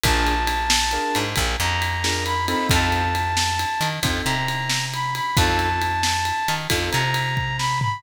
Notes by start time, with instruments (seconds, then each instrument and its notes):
0.03 electric bass (finger) A#1, acoustic grand piano D4 F4 G#4 A#4, brass section A5, kick, ride
0.27 ride
0.47 ride
0.70 snare
0.91 acoustic grand piano D4 F4 G#4 A#4, ride
1.15 electric bass (finger) G#2, ride
1.36 electric bass (finger) A#1, kick, ride
1.60 electric bass (finger) F2, brass section A#5, ride
1.82 ride
2.04 acoustic grand piano D4 F4 G#4 A#4, snare
2.25 brass section B5, ride
2.48 acoustic grand piano C4 D#4 F4 A4, brass section B5, ride
2.69 electric bass (finger) F2, brass section A5, kick, ride
2.92 ride
3.15 ride
3.37 snare
3.59 ride
3.81 electric bass (finger) D#3, ride
4.03 electric bass (finger) F2, acoustic grand piano C4 D#4 F4 A4, kick, ride
4.25 electric bass (finger) C3, brass section A#5, ride
4.48 ride
4.69 snare
4.94 brass section B5, ride
5.15 brass section B5, ride
5.36 electric bass (finger) F2, acoustic grand piano C4 D#4 F4 A4, brass section A5, kick, ride
5.59 ride
5.81 ride
6.03 snare
6.25 ride
6.48 electric bass (finger) D#3, ride
6.70 electric bass (finger) F2, acoustic grand piano C4 D#4 F4 A4, kick, ride
6.92 electric bass (finger) C3, brass section A#5, ride
7.14 ride
7.37 kick
7.58 brass section B5, snare
7.81 brass section B5, floor tom